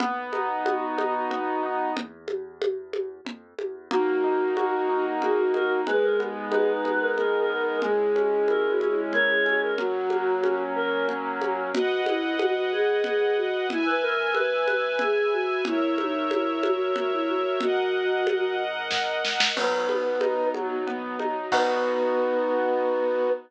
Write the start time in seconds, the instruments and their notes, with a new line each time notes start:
0.00 acoustic grand piano B1 B3, low conga
0.33 acoustic grand piano D#4, high conga
0.65 acoustic grand piano F#4, high conga
0.98 acoustic grand piano D#4, high conga
1.30 acoustic grand piano B3, low conga
1.63 acoustic grand piano D#4
1.97 acoustic grand piano E2, low conga
2.28 high conga
2.62 high conga
2.93 high conga
3.25 acoustic grand piano F2, low conga
3.59 acoustic grand piano E2, high conga
3.91 acoustic grand piano D#2 A#3, string ensemble 1 A#3 D#4 F#4, choir aahs D#4, flute F#4, low conga
4.24 acoustic grand piano D#4
4.57 acoustic grand piano F#4, choir aahs F#4, high conga
4.89 choir aahs D#4, acoustic grand piano D#4
5.22 acoustic grand piano A#3, choir aahs F#4, flute G#4, low conga
5.38 flute F#4
5.54 acoustic grand piano D#4, choir aahs A#4, high conga
5.86 acoustic grand piano G#1 G#3, string ensemble 1 G#3 B3 D#4, flute G#4, choir aahs B4, low conga
6.03 choir aahs A#4
6.20 acoustic grand piano B3, high conga
6.52 acoustic grand piano D#4, flute G#4, choir aahs B4, high conga
6.69 flute D#4
6.85 acoustic grand piano B3, high conga
7.01 flute A#4
7.17 acoustic grand piano G#3, flute G#4, choir aahs A#4, low conga
7.39 choir aahs A#4
7.50 acoustic grand piano B3, flute A#4
7.61 choir aahs A#4
7.82 acoustic grand piano C#2 G#3, string ensemble 1 G#3 C#4 E4, flute G#4, low conga
8.15 acoustic grand piano C#4, high conga
8.48 acoustic grand piano E4, choir aahs A#4, high conga
8.70 choir aahs F#4
8.80 acoustic grand piano C#4, high conga
8.91 choir aahs E4
9.13 acoustic grand piano G#3, flute A#4, choir aahs C#5, low conga
9.29 flute G#4
9.46 acoustic grand piano C#4, high conga
9.62 choir aahs A#4
9.78 acoustic grand piano F#2 F#3, string ensemble 1 F#3 A#3 C#4, choir aahs F#4, flute F#4, low conga
10.10 acoustic grand piano A#3, high conga
10.43 acoustic grand piano C#4, high conga
10.76 acoustic grand piano A#3, choir aahs A#4
11.09 acoustic grand piano F#3, low conga
11.41 acoustic grand piano A#3, high conga
11.73 acoustic grand piano G#1, choir aahs F#4, string ensemble 1 B4 D#5 F#5, low conga
12.06 choir aahs E4, high conga
12.39 choir aahs F#4, high conga
12.72 choir aahs G#4
13.04 choir aahs G#4, low conga
13.21 choir aahs G#4
13.37 choir aahs F#4
13.69 acoustic grand piano G#1, choir aahs E4, string ensemble 1 B4 E5 G#5, low conga
13.86 choir aahs B4
14.02 choir aahs A#4
14.34 choir aahs B4, high conga
14.67 choir aahs B4, high conga
14.99 choir aahs G#4, low conga
15.33 choir aahs F#4
15.65 acoustic grand piano G#1, choir aahs E4, string ensemble 1 A#4 C#5 E5, low conga
15.98 choir aahs D#4, high conga
16.30 choir aahs E4, high conga
16.63 choir aahs F#4, high conga
16.96 choir aahs F#4, low conga
17.12 choir aahs E4
17.28 choir aahs F#4
17.60 acoustic grand piano G#1, choir aahs F#4, string ensemble 1 A#4 D#5 F#5, low conga
18.27 high conga
18.91 kick, snare
19.25 snare
19.40 snare
19.56 acoustic grand piano B1 F#3, string ensemble 1 F#3 B3 D#4, choir aahs B3, flute B4, crash, low conga
19.89 acoustic grand piano B3, high conga
20.21 acoustic grand piano D#4, high conga
20.54 acoustic grand piano F#3, string ensemble 1 F#3 D#4 F#4, high conga
20.87 acoustic grand piano B3, choir aahs B3, low conga
21.19 acoustic grand piano D#4, high conga
21.52 acoustic grand piano B1 B3 D#4 F#4, choir aahs B3, string ensemble 1 B3 D#4 F#4, flute B4, kick, crash